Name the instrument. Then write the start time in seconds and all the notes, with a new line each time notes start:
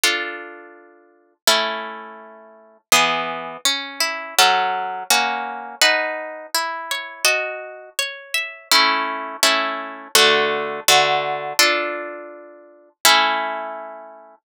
orchestral harp
0.04 D4 F4 A4
1.47 A3 C#4 E4
2.92 E3 B3 G#4
3.65 C#4
4.00 E4
4.39 F#3 C#4 A4
5.10 A#3 C#4 F#4
5.82 D#4 B4 F#5 A5
6.55 E4
6.91 C#5
7.25 F#4 D#5 A5
7.99 C#5
8.34 E5
8.72 A3 C#4 E4
9.43 A3 C#4 E4
10.15 D3 A3 F#4
10.88 D3 A3 F#4
11.59 D4 F4 A4
13.05 A3 C#4 E4